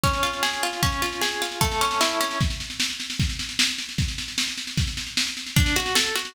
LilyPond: <<
  \new Staff \with { instrumentName = "Pizzicato Strings" } { \time 2/4 \key des \major \tempo 4 = 152 des'8 f'8 aes'8 f'8 | des'8 f'8 aes'8 f'8 | a8 cis'8 e'8 cis'8 | \key bes \minor r2 |
r2 | r2 | r2 | \key d \major d'8 fis'8 a'8 fis'8 | }
  \new DrumStaff \with { instrumentName = "Drums" } \drummode { \time 2/4 <bd sn>16 sn16 sn16 sn16 sn16 sn16 sn16 sn16 | <bd sn>16 sn16 sn16 sn16 sn16 sn16 sn16 sn16 | <bd sn>16 sn16 sn16 sn16 sn16 sn16 sn16 sn16 | <bd sn>16 sn16 sn16 sn16 sn16 sn16 sn16 sn16 |
<bd sn>16 sn16 sn16 sn16 sn16 sn16 sn16 sn16 | <bd sn>16 sn16 sn16 sn16 sn16 sn16 sn16 sn16 | <bd sn>16 sn16 sn16 sn16 sn16 sn16 sn16 sn16 | <bd sn>16 sn16 sn16 sn16 sn16 sn16 sn16 sn16 | }
>>